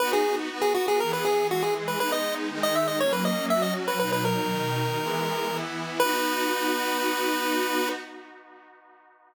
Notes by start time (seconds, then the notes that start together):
0.00 B3 D#4 F#4 B4
0.13 G#4
0.50 B3 F#4 B4
0.62 G#4
0.74 F#4
0.88 G#4
1.00 E3 B3 G#4 A#4
1.13 B4
1.25 G#4
1.49 E3 G#3 F#4 G#4
1.63 G#4
1.88 B4
1.99 G#3 B3 D#4 B4
2.12 D#5
2.50 D#3 G#3 D#4
2.63 D#5
2.75 E5
2.88 D#5
3.00 F#3 A#3 C#4 C#5
3.13 B4
3.25 D#5
3.50 F#3 C#4 F#4 E5
3.62 D#5
3.88 B4
3.99 B2 F#3 D#4 B4
4.12 B4
4.25 A#4
4.48 B2 D#3 D#4
5.00 E3 G#3 B3
5.50 E3 B3 E4
6.00 B3 D#4 F#4 B4